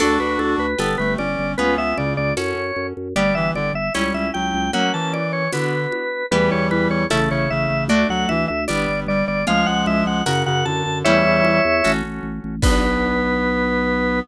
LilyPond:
<<
  \new Staff \with { instrumentName = "Drawbar Organ" } { \time 2/2 \key b \minor \tempo 2 = 76 a'8 b'8 a'8 b'8 a'8 b'8 d''4 | b'8 e''8 d''8 d''8 cis''4. r8 | d''8 e''8 d''8 e''8 cis''8 e''8 g''4 | fis''8 a''8 d''8 cis''8 b'2 |
b'8 cis''8 b'8 cis''8 a'8 cis''8 e''4 | d''8 fis''8 e''8 e''8 d''4 d''8 d''8 | eis''8 fis''8 e''8 fis''8 fis''8 fis''8 a''4 | <cis'' e''>2~ <cis'' e''>8 r4. |
b'1 | }
  \new Staff \with { instrumentName = "Clarinet" } { \time 2/2 \key b \minor <d' fis'>2 b8 a8 cis'4 | b8 b8 cis4 r2 | g8 e8 d8 r8 g4 fis4 | fis8 e4. d4 r4 |
<e g>2 cis8 cis8 cis4 | a8 fis8 e8 r8 g4 g4 | <eis gis>2 cis8 cis8 d4 | <e g>4. r2 r8 |
b1 | }
  \new Staff \with { instrumentName = "Acoustic Guitar (steel)" } { \time 2/2 \key b \minor <d' fis' a'>2 <d' g' b'>2 | <cis' eis' gis' b'>2 <cis' fis' a'>2 | <b d' g'>2 <cis' e' g'>2 | <ais cis' fis'>2 <b d' fis'>2 |
<b e' g'>2 <a cis' e'>2 | <a d' fis'>2 <b d' g'>2 | <cis' eis' gis'>2 <cis' fis' ais'>2 | <cis' e' g'>2 <cis' fis' a'>2 |
<b d' fis'>1 | }
  \new Staff \with { instrumentName = "Drawbar Organ" } { \clef bass \time 2/2 \key b \minor d,8 d,8 d,8 d,8 g,,8 g,,8 g,,8 g,,8 | cis,8 cis,8 cis,8 cis,8 fis,8 fis,8 fis,8 fis,8 | g,,8 g,,8 g,,8 g,,8 cis,8 cis,8 cis,8 cis,8 | r1 |
e,8 e,8 e,8 e,8 a,,8 a,,8 a,,8 a,,8 | d,8 d,8 d,8 d,8 g,,8 g,,8 g,,8 g,,8 | cis,8 cis,8 cis,8 cis,8 fis,8 fis,8 fis,8 fis,8 | e,8 e,8 e,8 e,8 a,,8 a,,8 a,,8 a,,8 |
b,,1 | }
  \new DrumStaff \with { instrumentName = "Drums" } \drummode { \time 2/2 <cgl cymc>4 cgho4 <cgho tamb>4 cgho4 | cgl4 cgho4 <cgho tamb>2 | cgl4 cgho4 <cgho tamb>4 cgho4 | cgl4 cgho4 <cgho tamb>4 cgho4 |
cgl4 cgho4 <cgho tamb>2 | cgl4 cgho4 <cgho tamb>2 | cgl4 cgho4 <cgho tamb>4 cgho4 | cgl4 cgho4 <cgho tamb>2 |
<cymc bd>2 r2 | }
>>